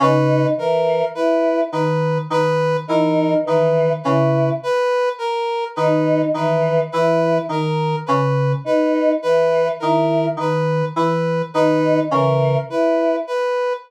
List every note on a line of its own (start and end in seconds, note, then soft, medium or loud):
0.00 0.46 C#3 medium
0.00 0.48 D#4 medium
0.00 0.47 B4 medium
0.57 1.03 E3 medium
0.57 1.05 A#4 medium
1.15 1.61 E4 medium
1.15 1.61 B4 medium
1.72 2.19 D#3 medium
1.72 2.18 B4 medium
2.30 2.76 D#3 medium
2.30 2.77 B4 medium
2.87 3.35 E3 medium
2.87 3.34 D#4 medium
2.87 3.34 A#4 medium
3.44 3.93 D#3 medium
3.44 3.90 E3 medium
3.44 3.93 B4 medium
4.03 4.51 C#3 medium
4.03 4.50 E4 medium
4.03 4.50 B4 medium
4.63 5.09 B4 medium
5.18 5.64 A#4 medium
5.76 6.23 D#3 medium
5.76 6.25 D#4 medium
5.76 6.22 B4 medium
6.34 6.80 D#3 medium
6.34 6.80 E3 medium
6.34 6.81 B4 medium
6.92 7.39 E3 medium
6.92 7.39 E4 medium
6.92 7.38 B4 medium
7.49 7.95 D#3 medium
7.49 7.96 A#4 medium
8.06 8.54 C#3 medium
8.06 8.52 B4 medium
8.64 9.11 D#4 medium
8.64 9.12 B4 medium
9.22 9.69 E3 medium
9.22 9.69 B4 medium
9.80 10.28 D#3 medium
9.80 10.26 E4 medium
9.80 10.26 A#4 medium
10.37 10.83 D#3 medium
10.37 10.85 B4 medium
10.96 11.42 E3 medium
10.96 11.42 B4 medium
11.54 12.00 D#3 medium
11.54 12.00 D#4 medium
11.54 12.00 B4 medium
12.10 12.57 C#3 medium
12.10 12.56 E3 medium
12.10 12.58 A#4 medium
12.69 13.15 E4 medium
12.69 13.16 B4 medium
13.27 13.73 B4 medium